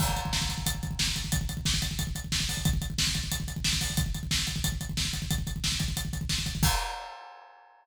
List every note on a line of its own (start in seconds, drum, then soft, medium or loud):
0.00 kick medium
0.00 crash medium
0.09 kick medium
0.16 kick medium
0.16 closed hi-hat medium
0.25 kick medium
0.33 kick medium
0.33 snare medium
0.41 kick medium
0.49 kick medium
0.49 closed hi-hat medium
0.58 kick medium
0.66 kick medium
0.66 closed hi-hat loud
0.75 kick medium
0.83 kick medium
0.83 closed hi-hat medium
0.91 kick medium
0.99 kick medium
0.99 snare loud
1.07 kick medium
1.16 kick medium
1.16 closed hi-hat medium
1.24 kick medium
1.32 kick medium
1.32 closed hi-hat medium
1.41 kick medium
1.49 kick medium
1.49 closed hi-hat medium
1.57 kick medium
1.65 kick medium
1.65 snare medium
1.74 kick medium
1.82 kick medium
1.82 closed hi-hat medium
1.91 kick medium
1.99 kick medium
1.99 closed hi-hat medium
2.07 kick medium
2.15 kick medium
2.15 closed hi-hat medium
2.24 kick medium
2.32 kick medium
2.32 snare medium
2.40 kick medium
2.49 kick medium
2.49 open hi-hat medium
2.57 kick medium
2.65 kick loud
2.65 closed hi-hat medium
2.73 kick medium
2.82 kick medium
2.82 closed hi-hat medium
2.90 kick medium
2.98 kick medium
2.98 snare loud
3.07 kick medium
3.15 kick medium
3.15 closed hi-hat medium
3.24 kick medium
3.32 kick medium
3.32 closed hi-hat medium
3.40 kick medium
3.48 kick medium
3.48 closed hi-hat medium
3.56 kick medium
3.64 kick medium
3.64 snare loud
3.73 kick medium
3.81 kick medium
3.81 open hi-hat medium
3.90 kick medium
3.97 kick loud
3.97 closed hi-hat medium
4.06 kick medium
4.14 kick medium
4.14 closed hi-hat medium
4.23 kick medium
4.31 kick medium
4.31 snare loud
4.39 kick medium
4.47 kick medium
4.47 closed hi-hat medium
4.56 kick medium
4.64 kick medium
4.64 closed hi-hat medium
4.72 kick medium
4.81 kick medium
4.81 closed hi-hat medium
4.89 kick medium
4.97 kick medium
4.97 snare medium
5.05 kick medium
5.13 kick medium
5.13 closed hi-hat medium
5.22 kick medium
5.31 kick medium
5.31 closed hi-hat medium
5.38 kick medium
5.47 kick medium
5.47 closed hi-hat medium
5.56 kick medium
5.64 kick medium
5.64 snare medium
5.72 kick medium
5.80 kick medium
5.80 closed hi-hat medium
5.88 kick medium
5.97 kick medium
5.97 closed hi-hat medium
6.05 kick medium
6.13 kick medium
6.13 closed hi-hat medium
6.21 kick medium
6.29 kick medium
6.29 snare medium
6.38 kick medium
6.46 kick medium
6.46 closed hi-hat medium
6.55 kick medium
6.63 kick loud
6.63 crash loud